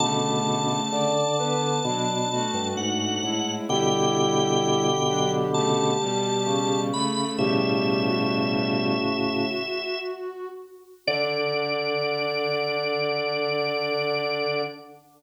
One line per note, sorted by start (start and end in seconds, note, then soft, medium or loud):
0.00 0.80 B2 loud
0.00 1.11 C#3 medium
0.00 0.80 D3 loud
0.00 1.11 A3 medium
0.00 2.68 A5 medium
0.91 1.79 D3 loud
0.91 1.35 D5 medium
1.38 1.81 D3 medium
1.38 1.81 B3 medium
1.38 1.61 B4 medium
1.61 1.83 B4 medium
1.84 2.47 B2 loud
1.84 2.25 F#3 medium
1.84 3.32 D4 medium
1.84 2.25 D4 medium
2.31 3.20 A3 medium
2.31 3.20 F#4 medium
2.54 2.76 G2 loud
2.77 3.18 G#2 medium
2.77 3.52 F#5 medium
3.23 3.61 A2 medium
3.23 3.67 G#3 medium
3.23 3.67 E4 medium
3.69 5.97 B2 loud
3.69 5.97 D3 loud
3.69 4.88 G3 medium
3.69 4.88 E4 medium
3.69 6.81 G4 loud
3.69 5.31 G5 medium
5.08 5.47 F#3 medium
5.08 5.47 D4 medium
5.54 5.91 C#3 medium
5.54 5.91 A3 medium
5.54 6.80 A5 medium
6.00 6.91 B2 medium
6.00 6.91 G3 medium
6.46 7.25 C#3 loud
6.92 7.37 C#3 medium
6.92 7.37 A3 medium
6.92 7.31 B5 medium
7.38 9.46 A2 loud
7.38 8.94 B2 medium
7.38 9.46 C#3 loud
7.38 8.94 G3 medium
7.38 8.00 G4 loud
7.38 10.00 E5 medium
8.08 10.48 F#4 medium
11.07 14.62 D3 loud
11.07 14.61 D4 loud
11.07 14.62 D5 loud